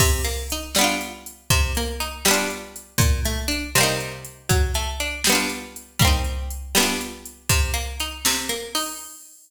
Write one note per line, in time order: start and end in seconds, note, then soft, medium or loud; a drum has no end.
0.00 0.22 C3 loud
0.00 kick medium
0.00 crash medium
0.24 0.47 A#3 medium
0.24 closed hi-hat medium
0.50 0.74 D#4 medium
0.50 closed hi-hat medium
0.75 1.43 G3 loud
0.75 1.43 B3 loud
0.75 snare medium
0.81 1.43 D4 loud
0.81 1.43 F4 loud
1.01 closed hi-hat medium
1.26 closed hi-hat medium
1.50 1.73 C3 loud
1.50 kick medium
1.50 closed hi-hat medium
1.75 1.99 A#3 loud
1.75 closed hi-hat medium
2.00 2.23 D#4 medium
2.00 closed hi-hat medium
2.25 2.93 G3 loud
2.25 2.93 B3 loud
2.25 snare loud
2.31 2.93 D4 loud
2.31 2.93 F4 loud
2.50 closed hi-hat medium
2.76 closed hi-hat medium
2.98 3.21 A#2 loud
2.98 kick loud
2.98 closed hi-hat medium
3.25 3.48 A3 loud
3.25 closed hi-hat medium
3.48 3.71 D4 medium
3.48 closed hi-hat medium
3.75 4.43 C3 loud
3.75 4.43 G3 loud
3.75 snare medium
3.81 4.43 A#3 loud
3.81 4.43 D#4 loud
4.00 closed hi-hat medium
4.25 closed hi-hat medium
4.49 4.72 F#3 loud
4.49 kick medium
4.49 closed hi-hat medium
4.74 4.97 A3 medium
4.74 closed hi-hat medium
5.00 5.23 D4 medium
5.00 closed hi-hat medium
5.24 5.94 G3 loud
5.24 snare loud
5.30 5.94 B3 loud
5.30 5.94 D4 loud
5.35 5.94 F4 loud
5.49 closed hi-hat medium
5.76 closed hi-hat medium
5.99 6.67 G3 loud
5.99 6.67 A#3 loud
5.99 kick loud
5.99 closed hi-hat medium
6.05 6.67 C4 loud
6.05 6.67 D#4 loud
6.24 closed hi-hat medium
6.51 closed hi-hat medium
6.75 7.42 G3 loud
6.75 7.42 B3 loud
6.75 snare loud
6.80 7.42 D4 loud
6.80 7.42 F4 loud
7.01 closed hi-hat medium
7.26 closed hi-hat medium
7.49 7.72 C3 loud
7.49 kick medium
7.49 closed hi-hat medium
7.74 7.96 A#3 medium
7.74 closed hi-hat medium
8.00 8.23 D#4 medium
8.00 closed hi-hat medium
8.25 8.48 C3 loud
8.25 snare loud
8.49 8.72 A#3 medium
8.49 closed hi-hat medium
8.75 8.97 D#4 loud
8.75 open hi-hat medium